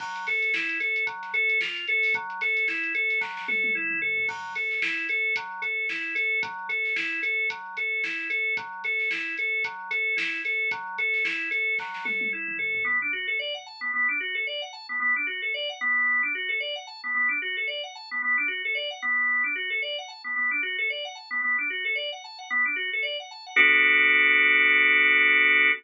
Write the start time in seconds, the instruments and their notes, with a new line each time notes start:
0.00 drawbar organ F#3, kick, crash
0.16 closed hi-hat
0.27 drawbar organ A4, snare, closed hi-hat
0.42 closed hi-hat
0.54 drawbar organ E4, snare
0.69 closed hi-hat
0.80 drawbar organ A4, snare, closed hi-hat
0.96 closed hi-hat
1.07 drawbar organ F#3, kick, closed hi-hat
1.23 snare, closed hi-hat
1.34 drawbar organ A4, closed hi-hat
1.50 closed hi-hat
1.61 drawbar organ F4, snare
1.76 closed hi-hat
1.87 drawbar organ A4, closed hi-hat
2.03 open hi-hat
2.14 drawbar organ F#3, kick, closed hi-hat
2.30 closed hi-hat
2.41 drawbar organ A4, snare, closed hi-hat
2.57 snare, closed hi-hat
2.68 drawbar organ E4, snare
2.84 closed hi-hat
2.95 drawbar organ A4, closed hi-hat
3.10 snare, closed hi-hat
3.21 drawbar organ F#3, kick, snare
3.37 snare
3.48 drawbar organ A4, high tom
3.64 high tom
3.75 drawbar organ E4, mid tom
3.91 mid tom
4.02 drawbar organ A4, floor tom
4.18 floor tom
4.29 drawbar organ F#3, kick, crash
4.55 drawbar organ A4, closed hi-hat
4.71 snare
4.82 drawbar organ E4, snare
5.09 drawbar organ A4, closed hi-hat
5.36 drawbar organ F#3, kick, closed hi-hat
5.62 drawbar organ A4, closed hi-hat
5.89 drawbar organ E4, snare
6.15 drawbar organ A4, snare, closed hi-hat
6.43 drawbar organ F#3, kick, closed hi-hat
6.69 drawbar organ A4, closed hi-hat
6.85 snare
6.96 drawbar organ E4, snare
7.23 drawbar organ A4, closed hi-hat
7.50 drawbar organ F#3, kick, closed hi-hat
7.77 drawbar organ A4, closed hi-hat
8.04 drawbar organ E4, snare
8.19 snare
8.30 drawbar organ A4, closed hi-hat
8.57 drawbar organ F#3, kick, closed hi-hat
8.84 drawbar organ A4, snare, closed hi-hat
9.00 snare
9.11 drawbar organ E4, snare
9.37 drawbar organ A4, closed hi-hat
9.64 drawbar organ F#3, kick, closed hi-hat
9.91 drawbar organ A4, closed hi-hat
10.17 drawbar organ E4, snare
10.33 snare
10.45 drawbar organ A4, closed hi-hat
10.71 drawbar organ F#3, kick, closed hi-hat
10.98 drawbar organ A4, closed hi-hat
11.14 snare
11.25 drawbar organ E4, snare
11.51 drawbar organ A4, closed hi-hat
11.79 drawbar organ F#3, kick, snare
11.94 snare
12.05 drawbar organ A4, high tom
12.21 high tom
12.33 drawbar organ E4
12.48 mid tom
12.59 drawbar organ A4, floor tom
12.75 floor tom
12.84 drawbar organ B3
13.02 drawbar organ D4
13.13 drawbar organ F#4
13.27 drawbar organ A4
13.39 drawbar organ D5
13.54 drawbar organ F#5
13.66 drawbar organ A5
13.81 drawbar organ B3
13.94 drawbar organ B3
14.09 drawbar organ D4
14.20 drawbar organ F#4
14.35 drawbar organ A4
14.47 drawbar organ D5
14.62 drawbar organ F#5
14.73 drawbar organ A5
14.89 drawbar organ B3
15.00 drawbar organ B3
15.16 drawbar organ D4
15.27 drawbar organ F#4
15.42 drawbar organ A4
15.54 drawbar organ D5
15.69 drawbar organ F#5
15.81 drawbar organ B3
16.23 drawbar organ D4
16.35 drawbar organ F#4
16.49 drawbar organ A4
16.60 drawbar organ D5
16.76 drawbar organ F#5
16.87 drawbar organ A5
17.04 drawbar organ B3
17.15 drawbar organ B3
17.29 drawbar organ D4
17.42 drawbar organ F#4
17.57 drawbar organ A4
17.67 drawbar organ D5
17.83 drawbar organ F#5
17.95 drawbar organ A5
18.11 drawbar organ B3
18.22 drawbar organ B3
18.38 drawbar organ D4
18.48 drawbar organ F#4
18.65 drawbar organ A4
18.75 drawbar organ D5
18.91 drawbar organ F#5
19.02 drawbar organ B3
19.44 drawbar organ D4
19.55 drawbar organ F#4
19.70 drawbar organ A4
19.82 drawbar organ D5
19.98 drawbar organ F#5
20.08 drawbar organ A5
20.24 drawbar organ B3
20.36 drawbar organ B3
20.51 drawbar organ D4
20.63 drawbar organ F#4
20.78 drawbar organ A4
20.90 drawbar organ D5
21.05 drawbar organ F#5
21.15 drawbar organ A5
21.31 drawbar organ B3
21.42 drawbar organ B3
21.58 drawbar organ D4
21.70 drawbar organ F#4
21.85 drawbar organ A4
21.95 drawbar organ D5
22.12 drawbar organ F#5
22.24 drawbar organ A5
22.39 drawbar organ F#5
22.50 drawbar organ B3
22.65 drawbar organ D4
22.76 drawbar organ F#4
22.93 drawbar organ A4
23.03 drawbar organ D5
23.20 drawbar organ F#5
23.31 drawbar organ A5
23.46 drawbar organ F#5
23.56 drawbar organ B3 D4 F#4 A4